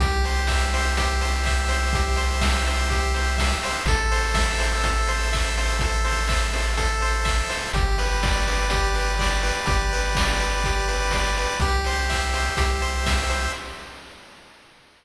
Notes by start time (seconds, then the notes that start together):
0.00 C2 G4, kick, closed hi-hat
0.24 C5, open hi-hat
0.47 E5, kick, snare
0.74 C5, open hi-hat
0.97 G4, kick, closed hi-hat
1.21 C5, open hi-hat
1.44 E5, kick, clap
1.68 C5, open hi-hat
1.93 G4, kick, closed hi-hat
2.16 C5, open hi-hat
2.41 E5, kick, snare
2.67 C5, open hi-hat
2.90 G4, kick, closed hi-hat
3.14 C5, open hi-hat
3.38 E5, kick, snare
3.63 C5, open hi-hat
3.86 A1 A4, kick, closed hi-hat
4.12 C5, open hi-hat
4.34 E5, kick, snare
4.59 C5, open hi-hat
4.84 A4, kick, closed hi-hat
5.07 C5, open hi-hat
5.33 E5, kick, clap
5.57 C5, open hi-hat
5.79 A4, kick, closed hi-hat
6.04 C5, open hi-hat
6.28 E5, kick, clap
6.53 C5, open hi-hat
6.77 A4, kick, closed hi-hat
7.01 C5, open hi-hat
7.25 E5, kick, clap
7.49 C5, open hi-hat
7.73 G1 G4, kick, closed hi-hat
7.98 B4, open hi-hat
8.23 D5, kick, snare
8.47 B4, open hi-hat
8.70 G4, kick, closed hi-hat
8.94 B4, open hi-hat
9.19 D5, kick, snare
9.43 B4, open hi-hat
9.66 G1 G4, kick, closed hi-hat
9.93 B4, open hi-hat
10.15 D5, kick, snare
10.40 B4, open hi-hat
10.64 G4, kick, closed hi-hat
10.88 B4, open hi-hat
11.11 D5, kick, snare
11.37 B4, open hi-hat
11.60 C2 G4, kick, closed hi-hat
11.84 C5, open hi-hat
12.09 E5, kick, clap
12.33 C5, open hi-hat
12.57 C2 G4, kick, closed hi-hat
12.81 C5, open hi-hat
13.06 E5, kick, snare
13.30 C5, open hi-hat